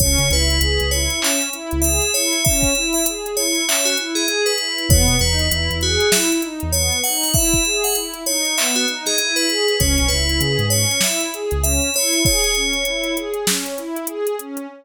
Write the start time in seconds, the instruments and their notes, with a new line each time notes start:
0.00 synth bass 2 C#2, pad 2 (warm) C#4, tubular bells C#5, kick, closed hi-hat
0.18 synth bass 2 C#3, closed hi-hat
0.29 synth bass 2 C#2, pad 2 (warm) E4, tubular bells B4, snare, closed hi-hat
0.50 closed hi-hat
0.61 synth bass 2 C#2, pad 2 (warm) G#4, closed hi-hat
0.80 synth bass 2 C#2, closed hi-hat
0.91 pad 2 (warm) E4, tubular bells C#5, closed hi-hat
1.10 closed hi-hat
1.21 pad 2 (warm) C#4, tubular bells E5, clap
1.42 closed hi-hat
1.53 pad 2 (warm) E4, closed hi-hat
1.71 synth bass 2 C#2, closed hi-hat
1.82 pad 2 (warm) G#4, tubular bells E5, closed hi-hat
2.02 closed hi-hat
2.14 pad 2 (warm) E4, tubular bells C#5, closed hi-hat
2.33 closed hi-hat
2.45 pad 2 (warm) C#4, tubular bells E5, kick, closed hi-hat
2.63 kick, closed hi-hat
2.75 pad 2 (warm) E4, closed hi-hat
2.93 tubular bells E5, closed hi-hat
3.06 pad 2 (warm) G#4, closed hi-hat
3.26 closed hi-hat
3.37 pad 2 (warm) E4, tubular bells C#5, closed hi-hat
3.55 closed hi-hat
3.67 pad 2 (warm) C#4, tubular bells E5, clap
3.85 tubular bells F#4, closed hi-hat
3.97 pad 2 (warm) E4, closed hi-hat
4.15 tubular bells G#4, closed hi-hat
4.28 pad 2 (warm) G#4, closed hi-hat
4.46 tubular bells B4, closed hi-hat
4.58 pad 2 (warm) E4, closed hi-hat
4.78 closed hi-hat
4.88 synth bass 2 E2, pad 2 (warm) B3, tubular bells C#5, kick, closed hi-hat
5.08 synth bass 2 B2, closed hi-hat
5.19 synth bass 2 E2, pad 2 (warm) D#4, tubular bells B4, closed hi-hat
5.39 closed hi-hat
5.50 synth bass 2 E2, pad 2 (warm) E4, closed hi-hat
5.70 synth bass 2 E2, closed hi-hat
5.81 tubular bells F#4, pad 2 (warm) G#4, closed hi-hat
6.00 closed hi-hat
6.12 pad 2 (warm) E4, tubular bells E5, snare
6.32 closed hi-hat
6.42 pad 2 (warm) D#4, closed hi-hat
6.60 synth bass 2 E2, closed hi-hat
6.72 pad 2 (warm) B3, tubular bells C#5, closed hi-hat
6.92 closed hi-hat
7.04 pad 2 (warm) D#4, tubular bells F#5, closed hi-hat
7.23 open hi-hat
7.34 pad 2 (warm) E4, tubular bells E5, kick, closed hi-hat
7.53 kick, closed hi-hat
7.65 pad 2 (warm) G#4, closed hi-hat
7.84 tubular bells F#5, closed hi-hat
7.95 pad 2 (warm) E4, closed hi-hat
8.14 closed hi-hat
8.26 pad 2 (warm) D#4, tubular bells C#5, closed hi-hat
8.45 closed hi-hat
8.57 pad 2 (warm) B3, tubular bells E5, clap
8.75 tubular bells F#4, closed hi-hat
8.87 pad 2 (warm) D#4, closed hi-hat
9.06 tubular bells G#4, snare, closed hi-hat
9.18 pad 2 (warm) E4, closed hi-hat
9.36 tubular bells B4, closed hi-hat
9.48 pad 2 (warm) G#4, closed hi-hat
9.68 closed hi-hat
9.79 synth bass 2 C#2, pad 2 (warm) C#4, tubular bells C#5, kick, closed hi-hat
9.98 synth bass 2 B1, closed hi-hat
10.08 synth bass 2 C#2, pad 2 (warm) E4, tubular bells B4, snare, closed hi-hat
10.29 closed hi-hat
10.40 synth bass 2 C#3, pad 2 (warm) G#4, closed hi-hat
10.59 synth bass 2 G#2, closed hi-hat
10.70 pad 2 (warm) C#4, tubular bells C#5, closed hi-hat
10.91 closed hi-hat
11.01 pad 2 (warm) E4, tubular bells E5, snare
11.20 closed hi-hat
11.34 pad 2 (warm) G#4, closed hi-hat
11.51 synth bass 2 C#2, closed hi-hat
11.62 pad 2 (warm) C#4, tubular bells E5, closed hi-hat
11.82 closed hi-hat
11.94 pad 2 (warm) E4, tubular bells C#5, closed hi-hat
12.13 closed hi-hat
12.25 pad 2 (warm) G#4, tubular bells C#5, kick, closed hi-hat
12.44 closed hi-hat
12.55 pad 2 (warm) C#4, closed hi-hat
12.73 closed hi-hat
12.85 pad 2 (warm) E4, closed hi-hat
13.04 closed hi-hat
13.16 pad 2 (warm) G#4, closed hi-hat
13.34 closed hi-hat
13.46 pad 2 (warm) C#4, snare
13.66 closed hi-hat
13.78 pad 2 (warm) E4, closed hi-hat
13.96 closed hi-hat
14.07 pad 2 (warm) G#4, closed hi-hat
14.27 closed hi-hat
14.39 pad 2 (warm) C#4, closed hi-hat
14.57 closed hi-hat